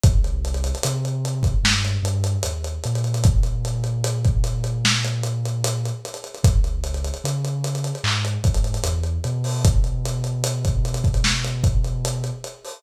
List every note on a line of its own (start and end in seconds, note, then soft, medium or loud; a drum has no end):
0.04 0.73 C2 medium
0.04 kick loud
0.04 closed hi-hat loud
0.24 closed hi-hat medium
0.45 closed hi-hat medium
0.54 closed hi-hat medium
0.64 closed hi-hat medium
0.75 closed hi-hat medium
0.83 1.53 C3 medium
0.83 closed hi-hat loud
1.05 closed hi-hat medium
1.25 closed hi-hat medium
1.43 kick medium
1.43 closed hi-hat medium
1.63 1.97 G2 medium
1.63 snare loud
1.85 closed hi-hat medium
2.03 2.37 G2 medium
2.03 closed hi-hat medium
2.24 closed hi-hat medium
2.43 2.79 D#2 soft
2.43 closed hi-hat loud
2.64 closed hi-hat medium
2.84 5.91 A#2 medium
2.84 closed hi-hat medium
2.95 closed hi-hat medium
3.04 closed hi-hat medium
3.14 closed hi-hat medium
3.24 kick loud
3.24 closed hi-hat medium
3.43 closed hi-hat medium
3.65 closed hi-hat medium
3.84 closed hi-hat medium
4.04 closed hi-hat loud
4.25 kick medium
4.25 closed hi-hat medium
4.44 closed hi-hat medium
4.64 closed hi-hat medium
4.85 snare loud
5.04 closed hi-hat medium
5.23 closed hi-hat medium
5.46 closed hi-hat medium
5.64 closed hi-hat loud
5.86 closed hi-hat medium
6.05 closed hi-hat medium
6.14 closed hi-hat medium
6.24 closed hi-hat medium
6.35 closed hi-hat medium
6.44 7.12 C#2 medium
6.44 kick loud
6.44 closed hi-hat loud
6.64 closed hi-hat medium
6.84 closed hi-hat medium
6.94 closed hi-hat medium
7.05 closed hi-hat medium
7.14 closed hi-hat medium
7.24 7.92 C#3 medium
7.24 closed hi-hat medium
7.45 closed hi-hat medium
7.64 closed hi-hat medium
7.75 closed hi-hat medium
7.84 closed hi-hat medium
7.95 closed hi-hat medium
8.04 8.38 G#2 medium
8.04 clap medium
8.25 closed hi-hat medium
8.44 8.78 G#2 medium
8.44 kick medium
8.44 closed hi-hat medium
8.54 closed hi-hat medium
8.64 closed hi-hat medium
8.74 closed hi-hat medium
8.84 9.18 E2 medium
8.84 closed hi-hat medium
9.04 closed hi-hat medium
9.24 12.31 B2 medium
9.24 closed hi-hat medium
9.44 open hi-hat medium
9.65 kick medium
9.65 closed hi-hat loud
9.84 closed hi-hat medium
10.06 closed hi-hat medium
10.24 closed hi-hat medium
10.44 closed hi-hat loud
10.65 kick medium
10.65 closed hi-hat medium
10.85 closed hi-hat medium
10.94 closed hi-hat medium
11.04 kick medium
11.04 closed hi-hat medium
11.14 closed hi-hat medium
11.24 snare loud
11.45 closed hi-hat medium
11.64 kick medium
11.64 closed hi-hat medium
11.84 closed hi-hat medium
12.05 closed hi-hat medium
12.24 closed hi-hat medium
12.44 closed hi-hat medium
12.65 open hi-hat medium